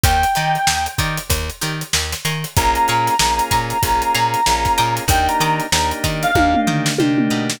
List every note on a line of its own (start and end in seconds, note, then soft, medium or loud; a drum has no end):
0.04 0.25 D#2 medium
0.04 0.17 D#4 medium
0.04 0.17 G4 medium
0.04 0.17 A#4 medium
0.04 0.17 D5 medium
0.04 0.85 G5 medium
0.04 kick loud
0.04 closed hi-hat medium
0.23 closed hi-hat medium
0.35 0.58 D#3 medium
0.35 0.60 D#4 medium
0.35 0.60 G4 medium
0.35 0.60 A#4 medium
0.35 0.60 D5 medium
0.35 closed hi-hat medium
0.55 closed hi-hat medium
0.67 0.88 D#2 medium
0.67 snare loud
0.86 closed hi-hat medium
0.98 1.19 D#3 medium
0.98 1.23 D#4 medium
0.98 1.23 G4 medium
0.98 1.23 A#4 medium
0.98 1.23 D5 medium
0.98 kick medium
0.98 closed hi-hat medium
1.18 closed hi-hat medium
1.30 1.50 D#2 medium
1.30 kick medium
1.30 closed hi-hat loud
1.50 closed hi-hat medium
1.61 1.83 D#3 medium
1.61 1.86 D#4 medium
1.61 1.86 G4 medium
1.61 1.86 A#4 medium
1.61 1.86 D5 medium
1.61 closed hi-hat medium
1.81 closed hi-hat medium
1.93 2.14 D#2 medium
1.93 snare medium
2.13 snare medium
2.13 closed hi-hat medium
2.25 2.45 D#3 medium
2.25 2.70 F5 medium
2.25 2.70 G#5 medium
2.25 2.70 A#5 medium
2.25 2.70 C#6 medium
2.25 snare soft
2.25 closed hi-hat medium
2.44 closed hi-hat medium
2.56 2.78 A#1 medium
2.56 3.14 A#3 medium
2.56 3.14 C#4 medium
2.56 3.14 F4 medium
2.56 3.14 G#4 medium
2.56 4.93 A#5 medium
2.56 kick medium
2.56 closed hi-hat medium
2.75 closed hi-hat medium
2.88 3.09 A#2 medium
2.88 3.13 F5 medium
2.88 3.13 G#5 medium
2.88 3.13 A#5 medium
2.88 3.13 C#6 medium
2.88 closed hi-hat medium
3.07 snare soft
3.07 closed hi-hat medium
3.19 3.41 A#1 medium
3.19 3.78 A#3 medium
3.19 3.78 C#4 medium
3.19 3.78 F4 medium
3.19 3.78 G#4 medium
3.19 snare loud
3.39 closed hi-hat medium
3.51 3.73 A#2 medium
3.51 3.75 F5 medium
3.51 3.75 G#5 medium
3.51 3.75 A#5 medium
3.51 3.75 C#6 medium
3.51 kick medium
3.51 closed hi-hat medium
3.70 closed hi-hat medium
3.82 4.03 A#1 medium
3.82 4.41 A#3 medium
3.82 4.41 C#4 medium
3.82 4.41 F4 medium
3.82 4.41 G#4 medium
3.82 kick medium
3.82 closed hi-hat loud
4.02 closed hi-hat medium
4.14 4.36 A#2 medium
4.14 4.39 F5 medium
4.14 4.39 G#5 medium
4.14 4.39 A#5 medium
4.14 4.39 C#6 medium
4.14 snare soft
4.14 closed hi-hat medium
4.34 closed hi-hat medium
4.46 4.68 A#1 medium
4.46 5.04 A#3 medium
4.46 5.04 C#4 medium
4.46 5.04 F4 medium
4.46 5.04 G#4 medium
4.46 snare medium
4.65 kick medium
4.65 snare soft
4.65 closed hi-hat medium
4.78 5.00 A#2 medium
4.78 5.23 D#5 medium
4.78 5.23 G5 medium
4.78 5.23 A#5 medium
4.78 5.23 D6 medium
4.78 closed hi-hat medium
4.97 closed hi-hat medium
5.08 5.28 D#2 loud
5.08 5.66 A#3 medium
5.08 5.66 D4 medium
5.08 5.66 D#4 loud
5.08 5.66 G4 medium
5.08 5.28 G5 medium
5.08 kick medium
5.08 closed hi-hat loud
5.28 5.40 A#5 medium
5.28 closed hi-hat medium
5.40 5.61 D#3 medium
5.40 5.65 D#5 medium
5.40 5.65 G5 medium
5.40 5.59 A#5 medium
5.40 5.65 A#5 medium
5.40 5.65 D6 medium
5.40 closed hi-hat medium
5.60 closed hi-hat medium
5.72 5.93 D#2 medium
5.72 6.31 A#3 medium
5.72 6.31 D4 medium
5.72 6.31 D#4 medium
5.72 6.31 G4 medium
5.72 5.90 A#5 medium
5.72 snare loud
5.91 closed hi-hat medium
6.04 6.25 D#3 medium
6.04 6.28 D#5 medium
6.04 6.28 G5 medium
6.04 6.28 A#5 medium
6.04 6.28 D6 medium
6.04 kick medium
6.04 closed hi-hat medium
6.23 6.60 F5 medium
6.23 closed hi-hat medium
6.35 6.56 D#2 medium
6.35 6.93 A#3 medium
6.35 6.93 D4 medium
6.35 6.93 D#4 medium
6.35 6.93 G4 medium
6.35 kick medium
6.35 high tom medium
6.54 mid tom medium
6.67 6.88 D#3 medium
6.67 6.91 D#5 medium
6.67 6.91 G5 medium
6.67 6.91 A#5 medium
6.67 6.91 D6 medium
6.67 floor tom medium
6.86 snare medium
6.98 7.29 C3 medium
6.98 7.56 A#3 medium
6.98 7.56 D4 medium
6.98 7.56 D#4 medium
6.98 7.56 G4 medium
6.98 high tom medium
7.18 mid tom medium
7.30 7.60 B2 medium
7.30 7.44 D#5 medium
7.30 7.44 G5 medium
7.30 7.44 A#5 medium
7.30 7.44 D6 medium
7.50 snare medium